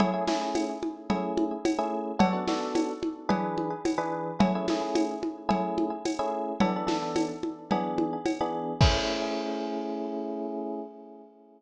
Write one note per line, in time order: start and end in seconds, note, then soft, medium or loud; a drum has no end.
0.00 0.10 A3 medium
0.00 0.10 C#4 medium
0.00 0.10 E4 loud
0.00 0.10 G#4 loud
0.00 cowbell medium
0.00 low conga loud
0.14 0.25 A3 medium
0.14 0.25 C#4 medium
0.14 0.25 E4 medium
0.14 0.25 G#4 medium
0.28 0.72 A3 medium
0.28 0.72 C#4 medium
0.28 0.72 E4 medium
0.28 0.72 G#4 medium
0.28 snare medium
0.28 high conga medium
0.55 tambourine medium
0.55 cowbell medium
0.55 high conga medium
0.83 high conga medium
1.10 1.54 A3 medium
1.10 1.54 C#4 medium
1.10 1.54 E4 medium
1.10 1.54 G#4 medium
1.10 cowbell medium
1.10 low conga medium
1.38 high conga medium
1.65 tambourine medium
1.65 cowbell medium
1.65 high conga loud
1.79 2.11 A3 medium
1.79 2.11 C#4 medium
1.79 2.11 E4 medium
1.79 2.11 G#4 medium
2.19 2.30 B3 medium
2.19 2.30 D4 medium
2.19 2.30 F#4 loud
2.19 2.30 A4 loud
2.19 cowbell loud
2.19 low conga loud
2.33 2.44 B3 medium
2.33 2.44 D4 medium
2.33 2.44 F#4 medium
2.33 2.44 A4 medium
2.47 2.92 B3 medium
2.47 2.92 D4 medium
2.47 2.92 F#4 medium
2.47 2.92 A4 medium
2.47 snare medium
2.47 high conga medium
2.75 tambourine medium
2.75 cowbell medium
2.75 high conga loud
3.03 high conga medium
3.29 3.73 E3 loud
3.29 3.73 D4 medium
3.29 3.73 G#4 loud
3.29 3.73 B4 medium
3.29 cowbell medium
3.29 low conga loud
3.58 high conga medium
3.85 tambourine medium
3.85 cowbell medium
3.85 high conga medium
3.98 4.31 E3 medium
3.98 4.31 D4 medium
3.98 4.31 G#4 medium
3.98 4.31 B4 medium
4.40 4.51 A3 medium
4.40 4.51 C#4 medium
4.40 4.51 E4 medium
4.40 4.51 G#4 medium
4.40 cowbell loud
4.40 low conga loud
4.55 4.66 A3 medium
4.55 4.66 C#4 medium
4.55 4.66 E4 medium
4.55 4.66 G#4 medium
4.68 5.14 A3 medium
4.68 5.14 C#4 medium
4.68 5.14 E4 medium
4.68 5.14 G#4 medium
4.68 snare medium
4.68 high conga medium
4.95 tambourine medium
4.95 cowbell medium
4.95 high conga loud
5.23 high conga medium
5.49 5.93 A3 medium
5.49 5.93 C#4 medium
5.49 5.93 E4 medium
5.49 5.93 G#4 medium
5.49 cowbell medium
5.49 low conga medium
5.78 high conga medium
6.05 tambourine medium
6.05 cowbell medium
6.05 high conga medium
6.19 6.52 A3 medium
6.19 6.52 C#4 medium
6.19 6.52 E4 medium
6.19 6.52 G#4 medium
6.60 6.72 E3 loud
6.60 6.72 B3 medium
6.60 6.72 D4 loud
6.60 6.72 A4 medium
6.60 cowbell loud
6.60 low conga loud
6.76 6.86 E3 medium
6.76 6.86 B3 medium
6.76 6.86 D4 medium
6.76 6.86 A4 medium
6.87 7.31 E3 medium
6.87 7.31 B3 medium
6.87 7.31 D4 medium
6.87 7.31 A4 medium
6.87 snare medium
6.87 high conga medium
7.16 tambourine medium
7.16 cowbell medium
7.16 high conga medium
7.43 high conga medium
7.71 8.16 E3 medium
7.71 8.16 B3 medium
7.71 8.16 D4 medium
7.71 8.16 G#4 loud
7.71 cowbell medium
7.71 low conga medium
7.98 high conga medium
8.26 tambourine medium
8.26 cowbell medium
8.26 high conga medium
8.40 8.74 E3 medium
8.40 8.74 B3 medium
8.40 8.74 D4 medium
8.40 8.74 G#4 medium
8.81 10.80 A3 loud
8.81 10.80 C#4 loud
8.81 10.80 E4 loud
8.81 10.80 G#4 medium
8.81 kick loud
8.81 crash loud